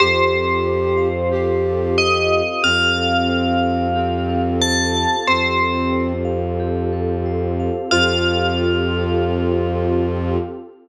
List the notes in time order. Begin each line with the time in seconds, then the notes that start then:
0.00 F2 C4 F4 G4 A4 C5
0.33 A4
0.67 C5
0.97 F5
1.32 G4
1.66 A4
1.98 C5 D#5
2.32 F5
2.62 F2 C4 F4 G4 A4 F5
2.97 A4
3.29 C5
3.63 F5
3.96 C4 G4
4.29 A4
4.60 C5 A5
4.96 F5
5.27 F2 C4 F4 G4 A4 C5
5.61 A4
5.93 C5
6.25 F5
6.60 G4
6.93 A4
7.26 C5
7.60 F5
7.91 F2 C4 F4 G4 A4 C5 F5